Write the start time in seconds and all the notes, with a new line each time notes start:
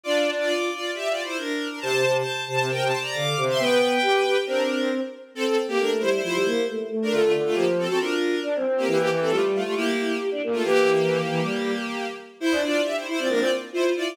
0.03 D4 F4 D5
0.39 F4 D5
0.70 F4 D5
0.94 G4 E5
1.08 F4 D5
1.23 E4 C5
1.37 D4 A#4
1.69 D4 A#4
1.80 C3 C5 A5
1.92 C3
2.04 C3
2.15 C5 A5
2.46 C3 C5 A5
2.59 C3
2.69 C3 A#4 G5
2.82 C3 C5 A5
3.01 D5 A#5
3.13 D3 F5 D6
3.37 C3
3.49 E5 C6
3.58 B3 B4 G5
4.02 G4
4.24 G4
4.36 G4
4.46 C4 D4 A#4
5.35 C4 A4
5.45 C4 A4
5.68 A#3 G4
5.79 A3 D4 A#4
6.00 G3 E4 C5
6.13 E4 C5
6.22 F3 E4 C5
6.35 G3
6.45 A#3
6.68 A3
6.89 A3
7.02 D4 A#4
7.11 D3 A3 F4
7.22 A3 F4
7.33 D3
7.45 A3 F4
7.54 F3 A#3 G4
7.79 C4 A4
7.87 C4 F#4 A4
7.99 D4 F4 A#4
8.43 D4
8.56 C4
8.66 C4
8.78 A#3 G4
8.86 E3 A#3 G4
8.98 A#3 G4
9.10 E3
9.20 C4 A4
9.30 G3 A3 F4
9.55 A3 F4
9.64 A3 F4 G4
9.75 A#3 E4 G4
10.20 G4
10.32 D4
10.43 A#3
10.52 A3 F4
10.63 E3 A#3 G4
11.29 E3
11.41 G3
12.40 E4 C5
12.52 D4
12.63 D4 F4 D5
12.84 G4 E5
12.96 E4 C5
13.06 E4 C5
13.18 C4 F4 D5
13.29 A#3 D4 A#4
13.39 C4 F4 D5
13.73 E4 F4 C5
13.96 E4 F4 D5